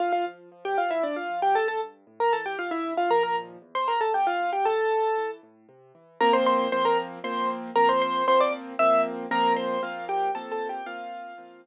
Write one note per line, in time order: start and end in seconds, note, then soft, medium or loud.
0.00 0.23 D2 medium
0.00 0.12 F4 medium
0.00 0.12 F5 medium
0.12 0.25 F4 medium
0.12 0.25 F5 medium
0.26 0.49 F3 medium
0.52 0.75 F3 medium
0.65 0.77 G4 medium
0.65 0.77 G5 medium
0.78 1.01 F3 medium
0.78 0.90 F4 medium
0.78 0.90 F5 medium
0.91 1.03 E4 medium
0.91 1.03 E5 medium
1.03 1.27 D2 medium
1.03 1.16 D4 medium
1.03 1.16 D5 medium
1.16 1.40 F4 medium
1.16 1.40 F5 medium
1.30 1.53 F3 medium
1.42 1.55 G4 medium
1.42 1.55 G5 medium
1.55 1.78 C#2 medium
1.55 1.68 A4 medium
1.55 1.68 A5 medium
1.68 1.80 A4 medium
1.68 1.80 A5 medium
1.81 2.04 G2 medium
2.07 2.30 A2 medium
2.20 2.32 A#4 medium
2.20 2.32 A#5 medium
2.33 2.56 E3 medium
2.33 2.45 A4 medium
2.33 2.45 A5 medium
2.46 2.58 G4 medium
2.46 2.58 G5 medium
2.59 2.82 C#2 medium
2.59 2.71 F4 medium
2.59 2.71 F5 medium
2.71 2.93 E4 medium
2.71 2.93 E5 medium
2.84 3.08 G2 medium
2.97 3.10 F4 medium
2.97 3.10 F5 medium
3.10 3.57 D#2 medium
3.10 3.57 A#2 medium
3.10 3.57 F3 medium
3.10 3.23 A#4 medium
3.10 3.23 A#5 medium
3.23 3.36 A#4 medium
3.23 3.36 A#5 medium
3.62 3.85 E2 medium
3.75 3.87 C5 medium
3.75 3.87 C6 medium
3.88 4.11 G#2 medium
3.88 4.00 A#4 medium
3.88 4.00 A#5 medium
4.01 4.13 A4 medium
4.01 4.13 A5 medium
4.14 4.37 B2 medium
4.14 4.26 G4 medium
4.14 4.26 G5 medium
4.27 4.51 F4 medium
4.27 4.51 F5 medium
4.40 4.63 E2 medium
4.53 4.65 G4 medium
4.53 4.65 G5 medium
4.65 4.89 A2 medium
4.65 5.30 A4 medium
4.65 5.30 A5 medium
4.91 5.14 C3 medium
5.17 5.41 E3 medium
5.43 5.66 A2 medium
5.69 5.92 C3 medium
5.95 6.18 E3 medium
6.21 6.67 F3 loud
6.21 6.67 A#3 loud
6.21 6.67 C4 loud
6.21 6.33 A#4 medium
6.21 6.33 A#5 loud
6.33 6.46 C5 medium
6.33 6.46 C6 medium
6.46 6.70 C5 medium
6.46 6.70 C6 medium
6.72 7.19 F3 loud
6.72 7.19 A#3 medium
6.72 7.19 C4 medium
6.72 6.84 C5 medium
6.72 6.84 C6 loud
6.85 6.97 A#4 medium
6.85 6.97 A#5 medium
7.24 7.70 F3 loud
7.24 7.70 A#3 loud
7.24 7.70 C4 medium
7.24 7.49 C5 medium
7.24 7.49 C6 medium
7.76 8.23 F3 medium
7.76 8.23 A#3 medium
7.76 8.23 C4 medium
7.76 7.88 A#4 medium
7.76 7.88 A#5 loud
7.89 8.01 C5 medium
7.89 8.01 C6 medium
8.02 8.25 C5 medium
8.02 8.25 C6 medium
8.28 8.74 F3 loud
8.28 8.74 A#3 medium
8.28 8.74 C4 medium
8.28 8.40 C5 medium
8.28 8.40 C6 loud
8.41 8.53 D5 medium
8.41 8.53 D6 medium
8.79 9.26 F3 medium
8.79 9.26 A#3 loud
8.79 9.26 C4 loud
8.79 9.02 E5 medium
8.79 9.02 E6 loud
9.31 9.77 F3 loud
9.31 9.77 A#3 loud
9.31 9.77 C4 loud
9.31 9.53 A#4 medium
9.31 9.53 A#5 loud
9.56 9.81 C5 medium
9.56 9.81 C6 medium
9.83 10.29 F3 medium
9.83 10.29 A#3 loud
9.83 10.29 C4 medium
9.83 10.05 F4 medium
9.83 10.05 F5 medium
10.09 10.31 G4 medium
10.09 10.31 G5 medium
10.35 10.81 F3 medium
10.35 10.81 A#3 medium
10.35 10.81 C4 loud
10.35 10.51 A4 medium
10.35 10.51 A5 medium
10.52 10.68 A4 medium
10.52 10.68 A5 medium
10.69 10.86 G4 medium
10.69 10.86 G5 medium
10.86 11.33 F3 loud
10.86 11.33 A#3 loud
10.86 11.33 C4 medium
10.86 11.61 F4 medium
10.86 11.61 F5 loud
11.38 11.66 F3 loud
11.38 11.66 A#3 medium
11.38 11.66 C4 loud